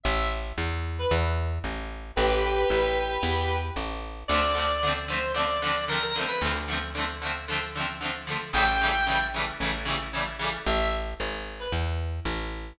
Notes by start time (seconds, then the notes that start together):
0.03 A1 E5
0.58 E2
0.99 B4
1.11 E2
1.64 A1
2.16 A1 G4 B4
2.70 A1
3.23 E2
3.76 A1
4.28 D2 D3 F3 D5
4.32 A3 C4
4.55 D3 F3 A3
4.59 C4
4.83 D3 F3 A3
4.88 C4
5.08 D3 F3 A3 C5
5.13 C4
5.34 D3 F3 A3 D5
5.39 C4
5.62 D3 F3 A3
5.67 C4
5.88 D3 F3 A3 A#4
5.93 C4
6.03 A#4
6.16 D3 F3 A3
6.20 C4
6.28 B4
6.41 D2 D3 F3 A3
6.46 C4
6.68 D3 F3 A3
6.73 C4
6.95 D3 F3 A3
7.00 C4
7.22 D3 F3 A3
7.27 C4
7.48 D3 F3 A3
7.53 C4
7.75 D3 F3 A3
7.80 C4
8.01 D3 F3 A3
8.06 C4
8.27 D3 F3 A3
8.32 C4
8.53 A1 C#3 E3 G3 G5
8.58 A3
8.81 C#3 E3 G3
8.86 A3
9.07 C#3 E3 G3
9.12 A3
9.34 C#3 E3 G3
9.39 A3
9.60 A1 C#3 E3 G3
9.65 A3
9.85 C#3 E3 G3
9.90 A3
10.13 C#3 E3 G3
10.18 A3
10.39 C#3 E3 G3
10.44 A3
10.66 A1 E5
11.20 G#1
11.60 B4
11.72 E2
12.25 A1